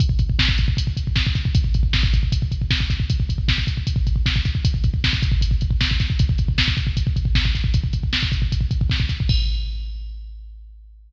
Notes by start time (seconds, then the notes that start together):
0.00 kick, closed hi-hat
0.09 kick
0.19 kick, closed hi-hat
0.30 kick
0.39 kick, snare
0.49 kick
0.58 kick, closed hi-hat
0.68 kick
0.77 kick, closed hi-hat
0.87 kick
0.97 kick, closed hi-hat
1.07 kick
1.16 kick, snare
1.27 kick
1.35 kick, snare, closed hi-hat
1.45 kick
1.55 kick, closed hi-hat
1.64 kick
1.74 kick, closed hi-hat
1.83 kick
1.93 kick, snare
2.03 kick
2.14 kick, closed hi-hat
2.23 kick
2.32 kick, closed hi-hat
2.42 kick
2.52 kick, closed hi-hat
2.62 kick
2.71 kick, snare
2.80 kick
2.90 kick, snare, closed hi-hat
3.00 kick
3.10 kick, closed hi-hat
3.20 kick
3.29 kick, closed hi-hat
3.38 kick
3.48 kick, snare
3.58 kick
3.67 kick, closed hi-hat
3.77 kick
3.87 kick, closed hi-hat
3.96 kick
4.07 kick, closed hi-hat
4.16 kick
4.26 kick, snare
4.36 kick
4.45 kick, snare, closed hi-hat
4.55 kick
4.65 kick, closed hi-hat
4.74 kick
4.84 kick, closed hi-hat
4.94 kick
5.04 kick, snare
5.13 kick
5.22 kick, closed hi-hat
5.32 kick
5.41 kick, closed hi-hat
5.51 kick
5.61 kick, closed hi-hat
5.71 kick
5.81 kick, snare
5.91 kick
6.00 kick, snare, closed hi-hat
6.10 kick
6.19 kick, closed hi-hat
6.29 kick
6.38 kick, closed hi-hat
6.48 kick
6.58 kick, snare
6.68 kick
6.77 kick, closed hi-hat
6.87 kick
6.97 kick, closed hi-hat
7.07 kick
7.16 kick, closed hi-hat
7.25 kick
7.35 kick, snare
7.45 kick
7.55 kick, snare, closed hi-hat
7.64 kick
7.74 kick, closed hi-hat
7.84 kick
7.93 kick, closed hi-hat
8.03 kick
8.13 kick, snare
8.23 kick
8.32 kick, closed hi-hat
8.42 kick
8.52 kick, closed hi-hat
8.61 kick
8.71 kick, closed hi-hat
8.81 kick
8.90 kick, snare
9.00 kick
9.09 kick, snare, closed hi-hat
9.20 kick
9.29 kick, crash